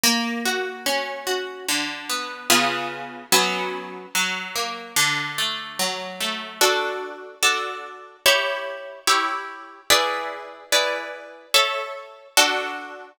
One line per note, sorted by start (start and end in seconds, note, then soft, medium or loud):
0.03 1.60 A#3 loud
0.45 1.26 F#4 medium
0.86 1.64 C#4 medium
1.27 1.66 F#4 medium
1.68 2.47 D3 loud
2.09 2.48 B3 medium
2.50 3.24 C#3 medium
2.50 3.24 B3 loud
2.50 3.24 F4 loud
2.50 3.24 G#4 loud
3.32 4.06 F#3 loud
3.32 4.06 B3 loud
3.32 4.06 C#4 loud
4.15 4.93 F#3 loud
4.55 4.95 A#3 medium
4.96 6.52 D3 loud
5.38 6.20 A3 medium
5.79 6.57 F#3 medium
6.20 6.59 A3 medium
6.61 7.35 D4 loud
6.61 7.35 F#4 loud
6.61 7.35 A4 loud
7.43 8.17 D4 medium
7.43 8.17 F#4 medium
7.43 8.17 A4 medium
8.26 9.00 E4 loud
8.26 9.00 G4 loud
8.26 9.00 C#5 loud
9.07 9.81 E4 medium
9.07 9.81 G4 medium
9.07 9.81 C#5 loud
9.90 10.64 E4 loud
9.90 10.64 G#4 loud
9.90 10.64 B4 loud
9.90 10.64 D5 loud
10.72 11.46 E4 medium
10.72 11.46 G#4 medium
10.72 11.46 B4 loud
10.72 11.46 D5 medium
11.54 12.28 A4 loud
11.54 12.28 C#5 loud
11.54 12.28 E5 loud
12.37 13.11 D4 loud
12.37 13.11 F#4 loud
12.37 13.11 A4 loud